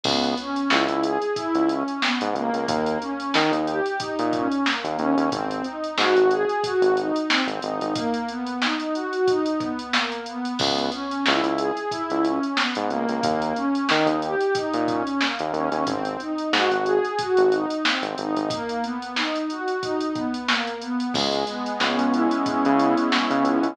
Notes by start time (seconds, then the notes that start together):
0.04 C#2 B3, kick, crash
0.23 closed hi-hat
0.38 C#4, closed hi-hat
0.56 closed hi-hat
0.70 C#2 E4, snare
0.88 C#2, closed hi-hat
1.03 G#4, closed hi-hat
1.22 closed hi-hat
1.35 E4, kick, closed hi-hat
1.54 C#2, closed hi-hat
1.69 C#4, closed hi-hat
1.88 closed hi-hat
2.01 B3, snare
2.21 G#2, closed hi-hat
2.34 C#2 A#3, closed hi-hat
2.53 C#2, closed hi-hat
2.68 D#2, kick, closed hi-hat
2.86 closed hi-hat
3.02 C#4, closed hi-hat
3.20 closed hi-hat
3.34 D#3 D#4, snare
3.52 D#2, closed hi-hat
3.66 G4, closed hi-hat
3.86 closed hi-hat
3.99 D#4, kick, closed hi-hat
4.19 A#2, closed hi-hat
4.33 C#4, kick, closed hi-hat
4.52 closed hi-hat
4.66 A#3, snare
4.84 D#2, closed hi-hat
4.99 D#2 C#4, closed hi-hat
5.17 D#2, closed hi-hat
5.32 G#1 C4, kick, closed hi-hat
5.51 closed hi-hat
5.64 D#4, closed hi-hat
5.84 closed hi-hat
5.97 G#2 F#4, snare
6.16 G#1, closed hi-hat
6.31 G#4, closed hi-hat
6.49 closed hi-hat
6.64 F#4, kick, closed hi-hat
6.82 G#1, closed hi-hat
6.97 D#4, closed hi-hat
7.16 closed hi-hat
7.30 C4, snare
7.47 G#1, closed hi-hat
7.62 G#1 D#4, closed hi-hat
7.81 G#1, closed hi-hat
7.95 A#3, kick, closed hi-hat
8.14 closed hi-hat
8.29 B3, closed hi-hat
8.47 closed hi-hat
8.62 D#4, snare
8.80 closed hi-hat
8.94 F#4, closed hi-hat
9.13 closed hi-hat
9.28 D#4, kick, closed hi-hat
9.46 closed hi-hat
9.60 B3, kick, closed hi-hat
9.79 closed hi-hat
9.93 A#3, snare
10.12 closed hi-hat
10.26 B3, closed hi-hat
10.45 closed hi-hat
10.58 C#2 B3, kick, crash
10.78 closed hi-hat
10.92 C#4, closed hi-hat
11.11 closed hi-hat
11.26 C#2 E4, snare
11.43 C#2, closed hi-hat
11.58 G#4, closed hi-hat
11.77 closed hi-hat
11.91 E4, kick, closed hi-hat
12.10 C#2, closed hi-hat
12.24 C#4, closed hi-hat
12.43 closed hi-hat
12.57 B3, snare
12.75 G#2, closed hi-hat
12.90 C#2 A#3, closed hi-hat
13.08 C#2, closed hi-hat
13.23 D#2, kick, closed hi-hat
13.42 closed hi-hat
13.55 C#4, closed hi-hat
13.75 closed hi-hat
13.89 D#3 D#4, snare
14.06 D#2, closed hi-hat
14.22 G4, closed hi-hat
14.41 closed hi-hat
14.54 D#4, kick, closed hi-hat
14.73 A#2, closed hi-hat
14.88 C#4, kick, closed hi-hat
15.07 closed hi-hat
15.21 A#3, snare
15.39 D#2, closed hi-hat
15.53 D#2 C#4, closed hi-hat
15.72 D#2, closed hi-hat
15.87 G#1 C4, kick, closed hi-hat
16.05 closed hi-hat
16.20 D#4, closed hi-hat
16.38 closed hi-hat
16.53 G#2 F#4, snare
16.71 G#1, closed hi-hat
16.86 G#4, closed hi-hat
17.05 closed hi-hat
17.19 F#4, kick, closed hi-hat
17.37 G#1, closed hi-hat
17.51 D#4, closed hi-hat
17.70 closed hi-hat
17.84 C4, snare
18.02 G#1, closed hi-hat
18.18 G#1 D#4, closed hi-hat
18.37 G#1, closed hi-hat
18.50 A#3, kick, closed hi-hat
18.69 closed hi-hat
18.83 B3, closed hi-hat
19.02 closed hi-hat
19.16 D#4, snare
19.36 closed hi-hat
19.50 F#4, closed hi-hat
19.68 closed hi-hat
19.83 D#4, kick, closed hi-hat
20.01 closed hi-hat
20.15 B3, kick, closed hi-hat
20.34 closed hi-hat
20.48 A#3, snare
20.67 closed hi-hat
20.81 B3, closed hi-hat
21.00 closed hi-hat
21.14 C#2 G#3, kick, crash
21.32 closed hi-hat
21.47 B3, closed hi-hat
21.66 closed hi-hat
21.80 C#2 C#4, snare
21.98 C#2, closed hi-hat
22.12 E4, closed hi-hat
22.31 closed hi-hat
22.46 C#4, kick, closed hi-hat
22.65 C#3, closed hi-hat
22.79 B3, closed hi-hat
22.97 closed hi-hat
23.12 G#3, snare
23.30 C#3, closed hi-hat
23.44 C#2 B3, closed hi-hat
23.63 C#2, closed hi-hat